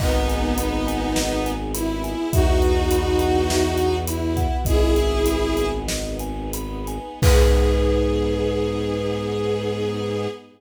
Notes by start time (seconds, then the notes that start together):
0.00 G#1 B3 D#4 G#4 D#5, kick, crash
0.28 G#5, closed hi-hat
0.58 B5, closed hi-hat
0.87 G#5, closed hi-hat
1.16 D#5, snare
1.46 G#5, closed hi-hat
1.74 E4 B5, closed hi-hat
2.04 G#5, closed hi-hat
2.33 E2 B3 D#4 E4 F#4 E5, kick, closed hi-hat
2.62 F#5, closed hi-hat
2.91 B5, closed hi-hat
3.19 F#5, closed hi-hat
3.50 E5, snare
3.78 F#5, closed hi-hat
4.07 E4 B5, closed hi-hat
4.37 F#5, kick, closed hi-hat
4.65 G#1 B3 D#4 E4 G#4 D#5, kick, closed hi-hat
4.96 G#5, closed hi-hat
5.26 B5, closed hi-hat
5.57 G#5, closed hi-hat
5.88 D#5, snare
6.19 G#5, closed hi-hat
6.53 B5, closed hi-hat
6.87 G#5, closed hi-hat
7.22 G#2 B3 D#4 G#4 B4, kick, crash